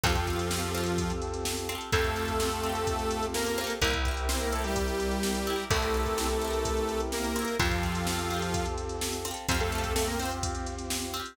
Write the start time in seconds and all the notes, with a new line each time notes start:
0.04 F2 F3 C4 F4 G4 A4, kick, closed hi-hat
0.10 G4 A4
0.15 kick, closed hi-hat
0.27 C4 F4, kick, closed hi-hat
0.33 G4 A4
0.39 closed hi-hat
0.51 C4 F4, snare
0.57 G4 A4
0.63 closed hi-hat
0.75 C4 F4, closed hi-hat
0.81 G4 A4
0.86 closed hi-hat
0.98 kick, closed hi-hat
1.10 closed hi-hat
1.22 closed hi-hat
1.34 closed hi-hat
1.45 snare
1.57 closed hi-hat
1.69 C4 F4, closed hi-hat
1.75 G4 A4
1.81 closed hi-hat
1.92 F2 A3 C4 F4 G4 A4, kick, closed hi-hat
1.99 G4 A4
2.04 kick, closed hi-hat
2.16 C4 F4, closed hi-hat
2.22 G4 A4
2.28 kick, closed hi-hat
2.40 C4 F4, snare
2.46 G4 A4
2.52 closed hi-hat
2.63 C4 F4, closed hi-hat
2.69 G4 A4
2.75 closed hi-hat
2.87 kick, closed hi-hat
2.99 closed hi-hat
3.11 closed hi-hat
3.23 closed hi-hat
3.34 A#3 A#4, snare
3.46 closed hi-hat
3.58 C4 F4, closed hi-hat
3.64 G4 A4
3.70 closed hi-hat
3.81 C2 A#3 C4 E4 G4 A#4, kick, closed hi-hat
3.88 G4 A#4
3.93 kick, closed hi-hat
4.05 C4 E4, kick, closed hi-hat
4.11 G4 A#4
4.17 closed hi-hat
4.29 C4 E4 C5, snare
4.35 G4 A#4
4.41 A#3 A#4, closed hi-hat
4.52 A3 C4 E4 A4, closed hi-hat
4.59 G4 A#4
4.64 G3 G4, closed hi-hat
4.76 kick, closed hi-hat
4.88 closed hi-hat
5.00 closed hi-hat
5.12 closed hi-hat
5.23 snare
5.35 closed hi-hat
5.47 C4 E4, closed hi-hat
5.53 G4 A#4
5.59 closed hi-hat
5.70 C2 A3 C4 E4 G4 A4 A#4, kick, closed hi-hat
5.77 G4 A#4
5.82 kick, closed hi-hat
5.94 C4 E4, closed hi-hat
6.00 G4 A#4
6.06 kick, closed hi-hat
6.18 C4 E4, snare
6.24 G4 A#4
6.30 closed hi-hat
6.42 C4 E4, closed hi-hat
6.48 G4 A#4
6.53 closed hi-hat
6.65 kick, closed hi-hat
6.77 closed hi-hat
6.89 closed hi-hat
7.00 closed hi-hat
7.12 A#3 A#4, snare
7.24 closed hi-hat
7.36 C4 E4, closed hi-hat
7.42 G4 A#4
7.48 closed hi-hat
7.59 F2 F3 C4 F4 G4 A4, kick, closed hi-hat
7.65 G4 A4
7.71 kick, closed hi-hat
7.83 C4 F4, kick, closed hi-hat
7.89 G4 A4
7.95 closed hi-hat
8.07 C4 F4, snare
8.13 G4 A4
8.19 closed hi-hat
8.30 C4 F4, closed hi-hat
8.37 G4 A4
8.42 closed hi-hat
8.54 kick, closed hi-hat
8.66 closed hi-hat
8.78 closed hi-hat
8.89 closed hi-hat
9.01 snare
9.13 closed hi-hat
9.25 C4 F4, closed hi-hat
9.31 G4 A4
9.37 closed hi-hat
9.49 F2 C4 F4 G4 C5, kick, closed hi-hat
9.55 G4
9.60 A3 A4, kick, closed hi-hat
9.72 C4 F4, closed hi-hat
9.78 G4
9.84 kick, closed hi-hat
9.95 A3 C4 F4 A4, snare
10.02 G4
10.07 A#3 A#4, closed hi-hat
10.19 C4 F4 C5, closed hi-hat
10.25 G4
10.31 closed hi-hat
10.43 kick, closed hi-hat
10.55 closed hi-hat
10.67 closed hi-hat
10.79 closed hi-hat
10.90 snare
11.02 closed hi-hat
11.14 C4 F4, closed hi-hat
11.20 G4
11.26 closed hi-hat